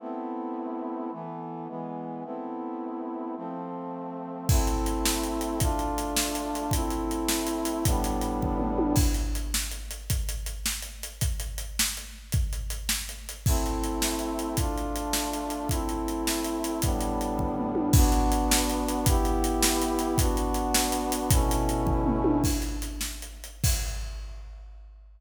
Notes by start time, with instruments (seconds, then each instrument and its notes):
0.00 brass section A3 B3 C4 E4
1.12 brass section E3 A3 B3
1.68 brass section E3 G#3 B3
2.24 brass section A3 B3 C4 E4
3.36 brass section F3 A3 C4
4.49 brass section A3 C4 E4, kick, crash
4.67 closed hi-hat
4.86 closed hi-hat
5.05 snare
5.23 closed hi-hat
5.41 closed hi-hat
5.60 brass section A3 D4 F4, kick, closed hi-hat
5.79 closed hi-hat
5.98 closed hi-hat
6.17 snare
6.35 closed hi-hat
6.55 closed hi-hat
6.71 brass section A3 C4 E4, kick, closed hi-hat
6.90 closed hi-hat
7.11 closed hi-hat
7.29 snare
7.47 closed hi-hat
7.65 closed hi-hat
7.85 brass section A2 G3 B3 D4, kick, closed hi-hat
8.04 closed hi-hat
8.21 closed hi-hat
8.42 kick, floor tom
8.60 mid tom
8.78 high tom
8.96 kick, crash
9.14 closed hi-hat
9.35 closed hi-hat
9.54 snare
9.71 closed hi-hat
9.91 closed hi-hat
10.10 kick, closed hi-hat
10.29 closed hi-hat
10.46 closed hi-hat
10.66 snare
10.82 closed hi-hat
11.03 closed hi-hat
11.21 kick, closed hi-hat
11.40 closed hi-hat
11.58 closed hi-hat
11.79 snare
11.97 closed hi-hat
12.32 kick, closed hi-hat
12.53 closed hi-hat
12.70 closed hi-hat
12.89 snare
13.09 closed hi-hat
13.29 closed hi-hat
13.46 brass section A3 C4 E4, kick, crash
13.66 closed hi-hat
13.84 closed hi-hat
14.02 snare
14.19 closed hi-hat
14.39 closed hi-hat
14.57 brass section A3 D4 F4, kick, closed hi-hat
14.78 closed hi-hat
14.96 closed hi-hat
15.13 snare
15.33 closed hi-hat
15.50 closed hi-hat
15.69 brass section A3 C4 E4, kick, closed hi-hat
15.89 closed hi-hat
16.08 closed hi-hat
16.27 snare
16.44 closed hi-hat
16.64 closed hi-hat
16.82 brass section A2 G3 B3 D4, kick, closed hi-hat
17.01 closed hi-hat
17.21 closed hi-hat
17.38 kick, floor tom
17.58 mid tom
17.75 high tom
17.93 brass section B3 D4 F#4, kick, crash
18.12 closed hi-hat
18.32 closed hi-hat
18.51 snare
18.70 closed hi-hat
18.88 closed hi-hat
19.06 brass section B3 E4 G4, kick, closed hi-hat
19.25 closed hi-hat
19.44 closed hi-hat
19.63 snare
19.82 closed hi-hat
19.99 closed hi-hat
20.18 brass section B3 D4 F#4, kick, closed hi-hat
20.37 closed hi-hat
20.54 closed hi-hat
20.74 snare
20.92 closed hi-hat
21.12 closed hi-hat
21.31 brass section B2 A3 C#4 E4, kick, closed hi-hat
21.51 closed hi-hat
21.69 closed hi-hat
21.86 kick, floor tom
22.06 mid tom
22.24 high tom
22.44 kick, crash
22.62 closed hi-hat
22.82 closed hi-hat
23.01 snare
23.22 closed hi-hat
23.44 closed hi-hat
23.64 kick, crash